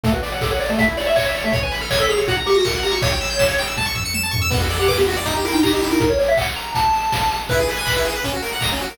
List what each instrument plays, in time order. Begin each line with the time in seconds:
0.03 lead 1 (square) A3 A4, kick, closed hi-hat
0.12 lead 1 (square) F#4 B4
0.22 lead 1 (square) D5, open hi-hat
0.32 lead 1 (square) C#5 F#5
0.41 lead 1 (square) A4 D6, kick, snare
0.51 lead 1 (square) C#5 F#5
0.59 lead 1 (square) D5, open hi-hat
0.69 lead 1 (square) A3
0.78 lead 1 (square) A3 E5, kick, closed hi-hat
0.87 lead 1 (square) E4
0.97 lead 1 (square) C#5 D5, open hi-hat
1.06 lead 1 (square) E5
1.16 lead 1 (square) C#5 C#6, kick, clap
1.25 lead 1 (square) C#5 E5
1.35 lead 1 (square) C#5 D5, open hi-hat
1.44 lead 1 (square) A3 E5
1.52 lead 1 (square) C#5, kick, closed hi-hat
1.63 lead 1 (square) B4 G#5
1.72 lead 1 (square) B5, open hi-hat
1.81 lead 1 (square) A4 F6
1.90 lead 1 (square) C#5 G#6, kick, snare
2.00 lead 1 (square) A4 B6
2.09 lead 1 (square) G#4 F7, open hi-hat
2.18 lead 1 (square) C#5
2.27 lead 1 (square) F#4 F#5, kick, closed hi-hat
2.37 lead 1 (square) A#5
2.46 lead 1 (square) G4 C#6, open hi-hat
2.54 lead 1 (square) F#4 A#6
2.64 lead 1 (square) A#4 C#7, kick, snare
2.74 lead 1 (square) A#4 F#5
2.83 lead 1 (square) G4 A#5, open hi-hat
2.91 lead 1 (square) F#4 C#6
3.02 lead 1 (square) C#5, kick, closed hi-hat
3.12 lead 1 (square) G5
3.21 lead 1 (square) E6, open hi-hat
3.30 lead 1 (square) G6
3.39 lead 1 (square) E7, kick, snare
3.48 lead 1 (square) C#5
3.58 lead 1 (square) G5, open hi-hat
3.67 lead 1 (square) E6
3.77 lead 1 (square) A5, kick, high tom
3.86 lead 1 (square) C#6
3.95 lead 1 (square) E6, floor tom
4.05 lead 1 (square) C#7
4.14 lead 1 (square) E7, high tom
4.23 lead 1 (square) A5
4.31 lead 1 (square) C#6, floor tom
4.42 lead 1 (square) E6
4.50 lead 1 (square) B3 B4, kick, crash
4.60 lead 1 (square) F#4 A4
4.70 lead 1 (square) D5, open hi-hat
4.79 lead 1 (square) G4 F#5
4.88 lead 1 (square) B4 D6, kick, clap
4.98 lead 1 (square) B3 G4
5.07 lead 1 (square) F#4, open hi-hat
5.16 lead 1 (square) D5
5.26 lead 1 (square) D#4, kick, closed hi-hat
5.36 lead 1 (square) G4
5.44 lead 1 (square) E4 A#4, open hi-hat
5.52 lead 1 (square) D#4 G5
5.63 lead 1 (square) G4 A#5, kick, clap
5.72 lead 1 (square) D#4 G4
5.81 lead 1 (square) E4 G4, open hi-hat
5.91 lead 1 (square) D#4 A#4
6.00 lead 1 (square) A#4, kick, closed hi-hat
6.10 lead 1 (square) C#5
6.19 lead 1 (square) C#5, open hi-hat
6.28 lead 1 (square) E5
6.37 lead 1 (square) F#5, kick, clap
6.56 lead 1 (square) A#5, open hi-hat
6.75 lead 1 (square) A5, kick, closed hi-hat
6.93 open hi-hat
7.12 kick, snare
7.31 open hi-hat
7.49 lead 1 (square) E4 B4, kick, closed hi-hat
7.59 lead 1 (square) G#4
7.67 lead 1 (square) B4, open hi-hat
7.77 lead 1 (square) G#5
7.85 lead 1 (square) B5, kick, clap
7.96 lead 1 (square) E4
8.05 lead 1 (square) G#4, open hi-hat
8.16 lead 1 (square) B4
8.24 lead 1 (square) C#4, kick, closed hi-hat
8.33 lead 1 (square) F#4
8.42 lead 1 (square) A#4, open hi-hat
8.53 lead 1 (square) F#5
8.60 lead 1 (square) A#5, kick, snare
8.72 lead 1 (square) C#4
8.80 lead 1 (square) F#4, open hi-hat
8.90 lead 1 (square) A#4